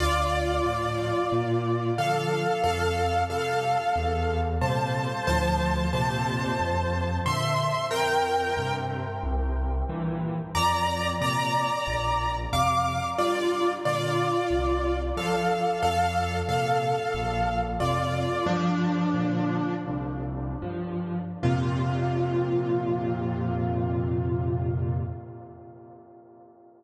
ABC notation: X:1
M:4/4
L:1/8
Q:1/4=91
K:F
V:1 name="Acoustic Grand Piano"
[Fd]2 [Fd]4 [Af]2 | [Af]2 [Af]4 [ca]2 | [ca]2 [ca]4 [ec']2 | [Bg]3 z5 |
[db]2 [db]4 [fd']2 | [Fd]2 [Fd]4 [Af]2 | [Af]2 [Af]4 [Fd]2 | "^rit." [F,D]4 z4 |
F8 |]
V:2 name="Acoustic Grand Piano" clef=bass
D,,2 [A,,F,]2 B,,2 [D,F,]2 | F,,2 [C,G,]2 E,,2 [B,,C,G,]2 | [D,,A,,F,]2 [F,,B,,C,]2 F,,2 [B,,D,]2 | F,,2 [G,,C,]2 C,,2 [G,,B,,E,]2 |
F,,2 [B,,C,]2 B,,,2 [F,,C,]2 | G,,2 [B,,D,]2 C,,2 [G,,F,]2 | F,,2 [B,,C,]2 B,,,2 [F,,C,]2 | "^rit." G,,2 [B,,D,]2 C,,2 [G,,F,]2 |
[F,,B,,C,]8 |]